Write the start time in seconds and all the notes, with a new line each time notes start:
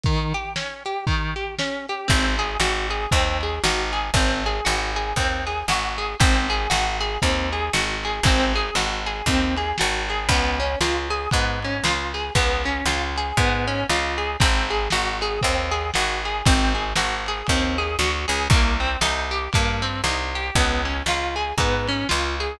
0.04 D#3, kick, closed hi-hat
0.34 G4, closed hi-hat
0.56 C#4, snare
0.85 G4, closed hi-hat
1.07 D#3, kick, closed hi-hat
1.36 G4, closed hi-hat
1.59 C#4, snare
1.89 G4, closed hi-hat
2.08 G#1 C4, kick, crash
2.39 G#4, ride
2.60 G#1 F#4, snare
2.90 G#4, ride
3.11 D#2 C4, kick, ride
3.41 G#4, ride
3.64 G#1 F#4, snare
3.93 G#4, ride
4.14 G#1 C4, kick, ride
4.46 G#4, ride
4.65 G#1 F#4, snare
4.96 G#4, ride
5.16 D#2 C4, kick, ride
5.47 G#4, ride
5.68 G#1 F#4, snare
5.98 G#4, ride
6.20 G#1 C4, kick, ride
6.49 G#4, ride
6.70 G#1 F#4, snare
7.01 G#4, ride
7.22 D#2 C4, kick, ride
7.52 G#4, ride
7.73 G#1 F#4, snare
8.04 G#4, ride
8.23 G#1 C4, kick, ride
8.54 G#4, ride
8.75 G#1 F#4, snare
9.06 G#4, ride
9.26 D#2 C4, kick, ride
9.57 G#4, ride
9.78 G#1 F#4, snare
10.09 G#4, ride
10.29 C#2 B3, kick, ride
10.60 C#4, ride
10.81 C#2 F4, snare
11.10 G#4, ride
11.31 G#2 B3, kick, ride
11.62 C#4, ride
11.84 C#2 F4, snare
12.14 G#4, ride
12.35 C#2 B3, kick, ride
12.64 C#4, ride
12.85 C#2 F4, snare
13.16 G#4, ride
13.37 G#2 B3, kick, ride
13.67 C#4, ride
13.89 C#2 F4, snare
14.18 G#4, ride
14.40 G#1 C4, kick, ride
14.70 G#4, ride
14.90 G#1 F#4, snare
15.21 G#4, ride
15.41 D#2 C4, kick, ride
15.71 G#4, ride
15.94 G#1 F#4, snare
16.25 G#4, ride
16.46 G#1 C4, kick, ride
16.75 G#4, ride
16.96 G#1 F#4, snare
17.26 G#4, ride
17.47 D#2 C4, kick, ride
17.78 G#4, ride
17.99 D2 F#4, snare
18.28 C#2 G#4, ride
18.50 C2 A#3, kick, ride
18.80 C4, ride
19.01 C2 D#4, snare
19.31 G4, ride
19.53 G2 A#3, kick, ride
19.82 C4, ride
20.04 C2 D#4, snare
20.35 G4, ride
20.55 C#2 B3, kick, ride
20.85 C#4, ride
21.06 C#2 F4, snare
21.36 G#4, ride
21.58 G#2 B3, kick, ride
21.88 C#4, ride
22.09 C#2 F4, snare
22.40 G#4, ride